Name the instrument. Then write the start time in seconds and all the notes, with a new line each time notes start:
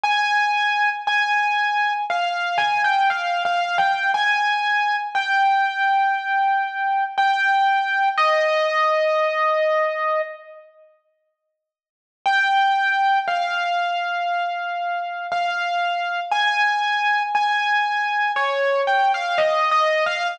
acoustic grand piano
0.04 G#5
1.07 G#5
2.10 F5
2.58 G#5
2.84 G5
3.10 F5
3.45 F5
3.78 G5
4.14 G#5
5.15 G5
7.18 G5
8.18 D#5
12.26 G5
13.28 F5
15.32 F5
16.32 G#5
17.35 G#5
18.36 C#5
18.87 G5
19.14 F5
19.38 D#5
19.71 D#5
20.06 F5